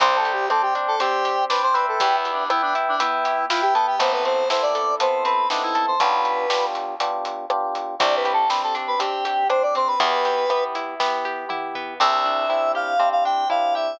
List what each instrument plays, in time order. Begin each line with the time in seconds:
0.00 electric bass (finger) C2, acoustic guitar (steel) C4, electric piano 1 C5 D5 G5, lead 1 (square) C5, kick, closed hi-hat
0.16 lead 1 (square) A4
0.25 acoustic guitar (steel) G4, closed hi-hat
0.33 lead 1 (square) G4
0.50 acoustic guitar (steel) C4, lead 1 (square) A4, electric piano 1 C5 D5 G5, cross-stick
0.62 lead 1 (square) G4
0.75 acoustic guitar (steel) D4, closed hi-hat
0.88 lead 1 (square) A4
1.00 acoustic guitar (steel) C4, lead 1 (square) G4, electric piano 1 C5 D5 G5, closed hi-hat
1.25 acoustic guitar (steel) G4, closed hi-hat
1.50 acoustic guitar (steel) D4, lead 1 (square) B4, electric piano 1 C5 D5 G5, snare
1.63 lead 1 (square) C5
1.74 acoustic guitar (steel) C4, lead 1 (square) B4, electric piano 1 B4 E5 G5, closed hi-hat
1.88 lead 1 (square) A4
2.00 electric bass (finger) E2, acoustic guitar (steel) B3, lead 1 (square) G4, kick, closed hi-hat
2.16 lead 1 (square) E4
2.25 acoustic guitar (steel) G4, closed hi-hat
2.33 lead 1 (square) D4
2.50 acoustic guitar (steel) B3, lead 1 (square) E4, electric piano 1 B4 E5 G5, cross-stick
2.62 lead 1 (square) D4
2.75 acoustic guitar (steel) E4, closed hi-hat
2.88 lead 1 (square) D4
3.00 acoustic guitar (steel) B3, lead 1 (square) E4, electric piano 1 B4 E5 G5, closed hi-hat
3.25 acoustic guitar (steel) G4, closed hi-hat
3.49 acoustic guitar (steel) E4, lead 1 (square) F4, electric piano 1 B4 E5 G5, snare
3.62 lead 1 (square) G4
3.74 acoustic guitar (steel) B3, lead 1 (square) A4, closed hi-hat
3.87 lead 1 (square) G4
3.99 electric bass (finger) A1, electric piano 1 B3 C4 E4 A4, acoustic guitar (steel) B3, lead 1 (square) C5, kick, closed hi-hat
4.12 lead 1 (square) B4
4.25 acoustic guitar (steel) C4, lead 1 (square) C5, closed hi-hat
4.50 electric piano 1 B3 C4 E4 A4, acoustic guitar (steel) E4, lead 1 (square) C5, snare
4.62 lead 1 (square) D5
4.75 acoustic guitar (steel) A4, closed hi-hat
5.00 acoustic guitar (steel) B3, electric piano 1 B3 C4 E4 A4, lead 1 (square) C5, closed hi-hat
5.25 acoustic guitar (steel) C4, lead 1 (square) B4, closed hi-hat
5.50 electric piano 1 B3 C4 E4 A4, lead 1 (square) D4, acoustic guitar (steel) D#4, snare
5.63 lead 1 (square) E4
5.75 acoustic guitar (steel) A4, closed hi-hat
5.88 lead 1 (square) C5
6.00 electric bass (finger) B1, electric piano 1 B3 D4 F4 G4, lead 1 (square) B4, kick, closed hi-hat
6.25 closed hi-hat
6.50 electric piano 1 B3 D4 F4 G4, snare
6.75 closed hi-hat
7.00 electric piano 1 B3 D4 F4 G4, closed hi-hat
7.25 closed hi-hat
7.50 electric piano 1 B3 D4 F4 G4, cross-stick
7.75 closed hi-hat
7.99 electric bass (finger) C2, electric piano 1 C4 D4 G4, acoustic guitar (steel) C4, lead 1 (square) D5, kick, closed hi-hat
8.16 lead 1 (square) B4
8.25 acoustic guitar (steel) G4, closed hi-hat
8.33 lead 1 (square) A4
8.49 acoustic guitar (steel) C4, electric piano 1 C4 D4 G4, lead 1 (square) B4, snare
8.63 lead 1 (square) A4
8.75 acoustic guitar (steel) D4, closed hi-hat
8.87 lead 1 (square) B4
8.99 electric piano 1 C4 D4 G4, acoustic guitar (steel) C4, lead 1 (square) G4, closed hi-hat
9.25 acoustic guitar (steel) G4, closed hi-hat
9.49 electric piano 1 C4 D4 G4, acoustic guitar (steel) D4, lead 1 (square) C5, cross-stick
9.63 lead 1 (square) D5
9.75 acoustic guitar (steel) C4, lead 1 (square) C5, closed hi-hat
9.88 lead 1 (square) B4
10.00 electric bass (finger) E2, acoustic guitar (steel) B3, electric piano 1 B3 E4 G4, lead 1 (square) B4, kick, closed hi-hat
10.25 acoustic guitar (steel) G4, closed hi-hat
10.50 electric piano 1 B3 E4 G4, acoustic guitar (steel) B3, cross-stick
10.75 acoustic guitar (steel) E4, closed hi-hat
11.00 electric piano 1 B3 E4 G4, acoustic guitar (steel) B3, kick, snare
11.25 acoustic guitar (steel) G4
11.49 electric piano 1 B3 E4 G4, acoustic guitar (steel) E4, mid tom
11.75 acoustic guitar (steel) B3, floor tom
12.00 electric bass (finger) C2, acoustic guitar (steel) C4, electric piano 1 C4 D4 E4 G4, lead 1 (square) E5
12.26 acoustic guitar (steel) D4
12.49 electric piano 1 C4 D4 E4 G4, acoustic guitar (steel) E4
12.75 acoustic guitar (steel) G4, lead 1 (square) F5
12.99 acoustic guitar (steel) C4, electric piano 1 C4 D4 E4 G4
13.12 lead 1 (square) F5
13.25 acoustic guitar (steel) D4, lead 1 (square) G5
13.50 electric piano 1 C4 D4 E4 G4, acoustic guitar (steel) E4, lead 1 (square) F5
13.75 acoustic guitar (steel) G4, lead 1 (square) E5